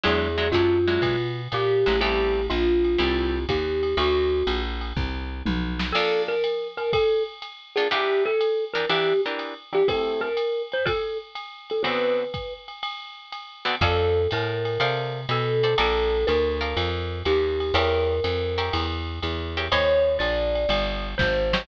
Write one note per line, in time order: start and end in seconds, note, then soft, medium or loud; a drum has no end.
0.03 0.52 E2 medium
0.03 0.27 F#3 loud
0.03 0.27 G#3 loud
0.03 0.27 D4 medium
0.03 0.27 E4 loud
0.03 0.50 G#4 medium
0.03 ride loud
0.38 0.48 F#3 medium
0.38 0.48 G#3 medium
0.38 0.48 D4 medium
0.38 0.48 E4 medium
0.52 0.99 F#2 medium
0.52 0.78 F#3 medium
0.52 0.78 G#3 medium
0.52 0.78 D4 medium
0.52 0.78 E4 medium
0.52 1.41 F4 medium
0.52 kick medium
0.52 hi-hat pedal medium
0.52 ride medium
0.87 1.16 F#3 loud
0.87 1.16 G#3 medium
0.87 1.16 D4 medium
0.87 1.16 E4 medium
0.87 ride medium
1.02 1.48 B2 medium
1.02 kick medium
1.02 ride loud
1.52 1.85 A#2 medium
1.52 2.00 G4 medium
1.52 hi-hat pedal loud
1.52 ride medium
1.86 2.49 A1 medium
1.86 1.97 F#3 medium
1.86 1.97 G#3 medium
1.86 1.97 D4 medium
1.86 1.97 E4 medium
1.86 ride medium
2.01 2.41 G3 loud
2.01 2.41 A3 loud
2.01 2.41 C4 medium
2.01 2.41 E4 loud
2.01 2.46 G4 medium
2.01 ride loud
2.50 2.97 A#1 medium
2.50 3.45 F4 medium
2.50 hi-hat pedal medium
2.50 ride medium
2.85 ride medium
2.98 3.46 C2 medium
2.98 3.39 G3 medium
2.98 3.39 A3 medium
2.98 3.39 C4 medium
2.98 3.39 E4 medium
2.98 ride loud
3.49 3.95 D#2 medium
3.49 3.97 G4 medium
3.49 kick medium
3.49 hi-hat pedal medium
3.49 ride loud
3.83 ride medium
3.97 4.43 D2 loud
3.97 4.63 F#4 medium
3.97 ride loud
4.47 4.93 A#1 medium
4.47 hi-hat pedal medium
4.47 ride loud
4.81 ride medium
4.97 5.43 C2 medium
4.97 kick medium
5.46 5.92 B1 medium
5.46 high tom loud
5.79 snare loud
5.92 6.36 A#3 loud
5.92 6.36 D4 loud
5.92 6.36 F4 loud
5.92 6.22 A4 medium
5.92 6.36 A4 loud
5.92 crash loud
5.92 ride loud
6.28 6.68 A#4 medium
6.44 hi-hat pedal medium
6.44 ride medium
6.77 6.91 A#4 medium
6.77 ride medium
6.93 7.23 A4 medium
6.93 kick medium
6.93 ride loud
7.42 hi-hat pedal medium
7.42 ride medium
7.76 7.88 A#3 medium
7.76 7.88 D4 medium
7.76 7.88 F4 medium
7.76 7.88 G#4 medium
7.76 7.88 A4 medium
7.76 ride medium
7.91 8.31 E3 loud
7.91 8.31 D4 loud
7.91 8.31 G4 loud
7.91 8.23 G4 medium
7.91 8.31 A#4 loud
7.91 ride loud
8.26 8.65 A4 medium
8.41 hi-hat pedal medium
8.41 ride medium
8.74 8.85 E3 medium
8.74 8.85 D4 medium
8.74 8.85 G4 medium
8.74 8.88 A#4 medium
8.74 8.85 A#4 loud
8.74 ride medium
8.89 9.13 E3 loud
8.89 9.13 D4 medium
8.89 9.13 G4 medium
8.89 9.21 G4 medium
8.89 9.13 A#4 medium
8.89 ride loud
9.26 9.54 E3 medium
9.26 9.54 D4 medium
9.26 9.54 G4 medium
9.26 9.54 A#4 loud
9.39 hi-hat pedal medium
9.39 ride medium
9.73 9.83 E3 medium
9.73 9.83 D4 medium
9.73 9.83 G4 medium
9.73 9.89 G4 medium
9.73 9.83 A#4 medium
9.73 ride medium
9.88 10.29 A3 loud
9.88 10.29 C4 loud
9.88 10.29 E4 loud
9.88 10.29 G4 loud
9.88 10.21 A4 medium
9.88 kick medium
9.88 ride loud
10.21 10.62 A#4 medium
10.37 hi-hat pedal medium
10.37 ride medium
10.72 10.88 C5 medium
10.72 ride medium
10.86 11.18 A4 medium
10.86 kick medium
10.86 ride loud
11.35 hi-hat pedal medium
11.35 ride medium
11.70 11.85 A4 medium
11.70 ride medium
11.83 12.24 D3 loud
11.83 12.24 B3 loud
11.83 12.24 C4 loud
11.83 12.24 F#4 loud
11.83 12.53 B4 medium
11.83 ride loud
12.34 kick medium
12.34 hi-hat pedal medium
12.34 ride medium
12.68 ride medium
12.83 ride loud
13.32 hi-hat pedal medium
13.32 ride medium
13.65 13.75 D3 medium
13.65 13.75 B3 loud
13.65 13.75 C4 loud
13.65 13.75 F#4 loud
13.65 ride medium
13.81 14.27 F2 loud
13.81 14.22 A4 medium
13.81 14.30 A4 medium
13.81 14.22 C5 loud
13.81 14.22 D5 loud
13.81 14.22 F5 loud
13.81 kick medium
13.81 ride loud
14.31 14.78 A2 medium
14.31 15.20 A#4 medium
14.31 hi-hat pedal loud
14.31 ride loud
14.65 ride medium
14.80 15.26 C3 medium
14.80 15.21 A4 medium
14.80 15.21 C5 loud
14.80 15.21 D5 loud
14.80 15.21 F5 loud
14.80 ride loud
15.29 15.75 B2 medium
15.29 15.77 A4 medium
15.29 hi-hat pedal loud
15.29 ride loud
15.63 15.74 A4 loud
15.63 15.74 C5 medium
15.63 15.74 D5 loud
15.63 15.74 F5 medium
15.63 ride medium
15.78 16.25 A#1 loud
15.78 16.18 A4 loud
15.78 16.28 A4 medium
15.78 16.18 A#4 loud
15.78 16.18 D5 loud
15.78 16.18 F5 loud
15.78 ride loud
16.27 16.75 D2 loud
16.27 17.19 A#4 medium
16.27 hi-hat pedal medium
16.27 ride loud
16.61 16.89 A4 medium
16.61 16.89 A#4 medium
16.61 16.89 D5 medium
16.61 16.89 F5 loud
16.61 ride medium
16.77 17.23 F2 medium
16.77 ride loud
17.25 17.72 D#2 medium
17.25 17.75 G4 medium
17.25 hi-hat pedal medium
17.25 ride loud
17.60 ride medium
17.74 18.20 E2 loud
17.74 18.15 G4 loud
17.74 18.96 A#4 medium
17.74 18.15 A#4 loud
17.74 18.15 C#5 loud
17.74 18.15 E5 loud
17.74 ride loud
18.24 18.70 F2 medium
18.24 hi-hat pedal loud
18.24 ride loud
18.58 18.86 G4 medium
18.58 18.86 A#4 medium
18.58 18.86 C#5 medium
18.58 18.86 E5 medium
18.58 ride loud
18.73 19.20 E2 medium
18.73 ride loud
19.22 19.69 E2 medium
19.22 hi-hat pedal loud
19.22 ride medium
19.57 19.68 G4 loud
19.57 19.68 A#4 loud
19.57 19.68 C#5 medium
19.57 19.68 E5 medium
19.57 ride medium
19.72 20.18 D#2 loud
19.72 20.12 G4 loud
19.72 20.12 C5 loud
19.72 20.12 C#5 loud
19.72 20.17 C#5 loud
19.72 20.12 D#5 loud
19.72 ride loud
20.19 20.66 A#1 medium
20.19 21.07 D5 medium
20.19 hi-hat pedal medium
20.19 ride loud
20.55 ride medium
20.69 21.15 G1 medium
20.69 ride loud
21.18 21.66 G#1 medium
21.18 21.62 C5 medium
21.18 kick medium
21.18 snare loud
21.53 21.64 G4 medium
21.53 21.64 C5 medium
21.53 21.64 C#5 loud
21.53 21.64 D#5 medium
21.53 snare loud